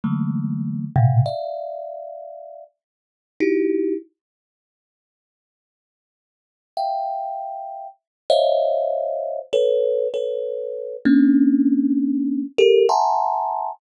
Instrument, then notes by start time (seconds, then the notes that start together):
kalimba
0.04 D3 E3 F#3 G#3 A3 A#3
0.96 A2 A#2 B2 C3
1.26 D5 E5 F5
3.40 D#4 E4 F#4 G4
6.77 E5 F5 G5
8.30 C5 C#5 D#5 E5 F5
9.53 A4 B4 C#5
10.14 A4 B4 C#5
11.05 A#3 C4 C#4 D4
12.58 G4 A4 A#4
12.89 E5 F#5 G#5 A5 A#5 C6